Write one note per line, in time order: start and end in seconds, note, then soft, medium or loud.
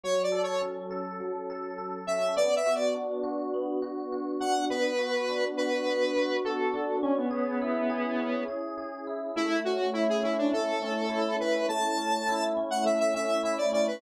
0.04 1.20 F#3 medium
0.04 0.22 C#5 loud
0.23 0.42 D5 medium
0.32 0.90 A4 medium
0.43 0.62 C#5 medium
0.62 2.07 C#4 medium
0.91 1.49 A4 medium
1.20 2.31 F#3 medium
1.50 1.78 A4 medium
1.78 2.33 A4 medium
2.07 2.35 C#4 medium
2.07 2.35 E5 medium
2.36 3.54 B3 medium
2.36 2.55 D5 loud
2.56 2.75 E5 loud
2.66 3.23 F#4 medium
2.75 2.94 D5 medium
2.95 4.40 D4 medium
3.23 3.82 F#4 medium
3.54 4.65 B3 medium
3.82 4.12 F#4 medium
4.12 4.68 F#4 medium
4.40 4.68 D4 medium
4.40 4.65 F#5 medium
4.70 5.85 B3 medium
4.70 5.45 B4 medium
4.98 5.58 F#4 medium
5.29 6.73 D4 medium
5.57 6.16 F#4 medium
5.57 6.37 B4 medium
5.86 6.96 B3 medium
6.17 6.44 F#4 medium
6.45 7.00 F#4 medium
6.45 6.98 A4 medium
6.74 7.01 D4 medium
7.02 7.16 C#4 loud
7.02 8.19 C#4 medium
7.17 8.44 B3 medium
7.31 7.89 G#4 medium
7.62 9.07 E4 medium
7.90 8.48 G#4 medium
8.19 9.30 C#4 medium
8.48 8.77 G#4 medium
8.78 9.33 G#4 medium
9.07 9.35 E4 medium
9.36 10.52 A3 medium
9.36 9.60 E4 loud
9.65 10.23 C#4 medium
9.65 9.90 F#4 medium
9.93 10.07 E4 medium
9.93 11.09 E4 medium
10.09 10.23 G#4 medium
10.23 10.81 C#4 medium
10.23 10.37 E4 medium
10.38 10.52 D4 medium
10.53 11.68 A3 medium
10.53 11.36 A4 medium
10.82 11.40 C#4 medium
11.09 12.28 E4 medium
11.40 11.97 C#4 medium
11.40 11.66 B4 medium
11.69 12.83 A3 medium
11.69 12.44 A5 medium
11.97 12.56 C#4 medium
12.29 13.43 E4 medium
12.57 13.14 C#4 medium
12.71 12.84 F#5 medium
12.84 13.94 A3 medium
12.84 12.99 E5 medium
13.00 13.14 E5 medium
13.14 13.72 C#4 medium
13.14 13.42 E5 medium
13.43 13.99 E4 medium
13.43 13.57 E5 medium
13.58 13.71 D5 medium
13.73 14.00 C#4 medium
13.73 13.87 D5 medium
13.87 14.01 B4 medium